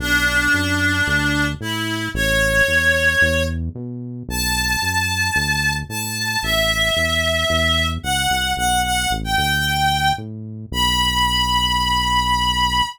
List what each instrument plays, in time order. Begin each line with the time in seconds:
0.00 synth bass 1 B1, clarinet D4
0.54 synth bass 1 F#2
1.07 synth bass 1 D2
1.61 synth bass 1 A2, clarinet E4
2.14 synth bass 1 A1, clarinet C#5
2.68 synth bass 1 E2
3.21 synth bass 1 E2
3.75 synth bass 1 B2
4.29 synth bass 1 B1, clarinet A5
4.82 synth bass 1 F#2
5.36 synth bass 1 D2
5.89 synth bass 1 A2, clarinet A5
6.43 synth bass 1 A1, clarinet E5
6.96 synth bass 1 E2
7.50 synth bass 1 E2
8.03 synth bass 1 C#2, clarinet F#5
8.30 synth bass 1 C2
8.57 synth bass 1 B1, clarinet F#5
8.84 clarinet F#5
9.11 synth bass 1 A1
9.24 clarinet G5
9.36 synth bass 1 D2, clarinet G5
10.18 synth bass 1 A2
10.71 synth bass 1 B1, clarinet B5